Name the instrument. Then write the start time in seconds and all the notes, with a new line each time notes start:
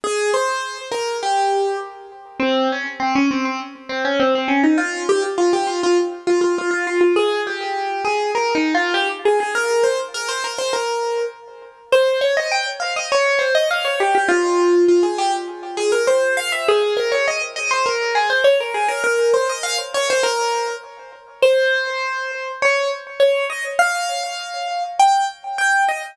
acoustic grand piano
0.04 G#4
0.34 C5
0.91 A#4
1.23 G4
2.40 C4
2.72 C#4
3.00 C4
3.15 C#4
3.31 C4
3.45 C4
3.89 C4
4.05 C#4
4.20 C4
4.35 C4
4.48 C#4
4.63 D#4
4.78 F4
5.09 G4
5.38 F4
5.53 G4
5.67 F4
5.83 F4
6.27 F4
6.41 F4
6.58 F4
6.71 F4
6.87 F4
7.01 F4
7.16 G#4
7.47 G4
8.05 G#4
8.35 A#4
8.55 D#4
8.75 F4
8.94 G4
9.25 G#4
9.40 G#4
9.55 A#4
9.83 C5
10.14 A#4
10.28 C5
10.44 A#4
10.58 C5
10.73 A#4
11.92 C5
12.21 C#5
12.37 D#5
12.51 G5
12.80 F5
12.96 D#5
13.12 C#5
13.39 C5
13.55 D#5
13.71 F5
13.85 C#5
14.00 G4
14.15 G4
14.28 F4
14.88 F4
15.03 G#4
15.18 G4
15.77 G#4
15.92 A#4
16.07 C5
16.37 F5
16.52 E5
16.68 G#4
16.97 A#4
17.12 C#5
17.28 D#5
17.56 D#5
17.71 C5
17.86 A#4
18.15 G#4
18.30 C5
18.44 C#5
18.60 A#4
18.74 G#4
18.88 A#4
19.04 A#4
19.34 C5
19.49 D#5
19.63 F5
19.94 C#5
20.10 C5
20.23 A#4
21.42 C5
22.62 C#5
23.20 C#5
23.50 D#5
23.79 F5
24.99 G5
25.58 G5
25.88 D#5